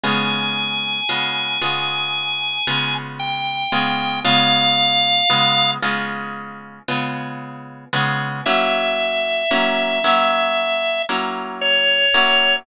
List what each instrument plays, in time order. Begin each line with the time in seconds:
0.04 acoustic guitar (steel) C#3 G#3 B3 F4, drawbar organ G#5
1.09 acoustic guitar (steel) C#3 G#3 B3 F4
1.62 acoustic guitar (steel) C#3 G#3 B3 F4
2.67 acoustic guitar (steel) C#3 G#3 B3 F4
3.20 drawbar organ G5
3.72 acoustic guitar (steel) C#3 G#3 B3 F4
4.25 acoustic guitar (steel) C#3 G#3 B3 F4, drawbar organ F5
5.30 acoustic guitar (steel) C#3 G#3 B3 F4
5.82 acoustic guitar (steel) C#3 G#3 B3 F4
6.88 acoustic guitar (steel) C#3 G#3 B3 F4
7.93 acoustic guitar (steel) C#3 G#3 B3 F4
8.46 acoustic guitar (steel) F#3 A#3 C#4 E4, drawbar organ E5
9.51 acoustic guitar (steel) F#3 A#3 C#4 E4
10.04 acoustic guitar (steel) F#3 A#3 C#4 E4
11.09 acoustic guitar (steel) F#3 A#3 C#4 E4
11.61 drawbar organ C#5
12.14 acoustic guitar (steel) F#3 A#3 C#4 E4